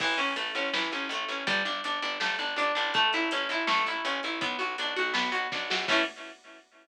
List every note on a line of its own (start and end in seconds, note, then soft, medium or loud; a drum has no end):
0.00 0.15 A1 medium
0.00 0.18 E3 loud
0.00 kick loud
0.00 crash loud
0.18 0.34 A1 medium
0.18 0.34 C#4 medium
0.18 closed hi-hat medium
0.36 0.52 A1 medium
0.36 0.53 A3 medium
0.36 closed hi-hat loud
0.55 0.70 A1 medium
0.55 0.72 C#4 medium
0.55 closed hi-hat medium
0.73 0.89 A1 medium
0.73 0.90 E3 medium
0.73 snare loud
0.92 1.08 A1 medium
0.92 1.09 C#4 medium
0.92 closed hi-hat medium
1.09 1.25 A1 medium
1.09 1.29 A3 medium
1.09 closed hi-hat loud
1.28 1.44 A1 medium
1.28 1.46 C#4 medium
1.28 closed hi-hat medium
1.47 1.63 G1 loud
1.47 1.63 G3 loud
1.47 kick loud
1.47 closed hi-hat loud
1.65 1.81 G1 medium
1.65 1.82 D4 medium
1.65 closed hi-hat medium
1.84 2.00 G1 medium
1.84 2.02 D4 medium
1.84 closed hi-hat loud
2.02 2.18 G1 medium
2.02 2.19 D4 medium
2.02 closed hi-hat medium
2.20 2.37 G1 medium
2.20 2.37 A3 medium
2.20 snare loud
2.39 2.55 G1 medium
2.39 2.55 D4 medium
2.39 closed hi-hat medium
2.56 2.72 G1 medium
2.56 2.74 D4 medium
2.56 closed hi-hat loud
2.75 3.11 A1 medium
2.75 2.92 D4 medium
2.75 closed hi-hat medium
2.94 3.11 A3 loud
2.94 kick loud
2.94 closed hi-hat loud
3.13 3.29 A1 medium
3.13 3.30 E4 medium
3.13 closed hi-hat medium
3.31 3.48 A1 medium
3.31 3.49 C#4 medium
3.31 closed hi-hat loud
3.49 3.65 A1 medium
3.49 3.68 E4 medium
3.49 closed hi-hat medium
3.67 3.83 A1 medium
3.67 3.84 A3 loud
3.67 snare loud
3.86 4.02 A1 medium
3.86 4.05 E4 medium
3.86 closed hi-hat medium
4.05 4.20 A1 medium
4.05 4.21 C#4 medium
4.05 closed hi-hat loud
4.23 4.39 A1 medium
4.23 4.41 E4 medium
4.23 closed hi-hat medium
4.41 4.57 B1 medium
4.41 4.58 B3 loud
4.41 kick loud
4.41 closed hi-hat loud
4.59 4.76 B1 medium
4.59 4.75 F#4 medium
4.59 closed hi-hat medium
4.78 4.94 B1 medium
4.78 4.96 D4 medium
4.78 closed hi-hat loud
4.96 5.13 B1 medium
4.96 5.13 F#4 medium
4.96 closed hi-hat medium
5.14 5.30 B1 medium
5.14 5.30 B3 medium
5.14 snare loud
5.32 5.48 B1 medium
5.32 5.48 F#4 medium
5.32 closed hi-hat medium
5.52 5.69 B1 medium
5.52 5.68 D4 medium
5.52 kick loud
5.52 snare loud
5.70 5.87 A#1 medium
5.70 5.87 F#4 medium
5.70 snare loud
5.88 6.01 A2 loud
5.88 6.02 E3 loud
5.88 6.02 A3 loud
5.88 6.02 C#4 loud
5.88 kick loud
5.88 crash loud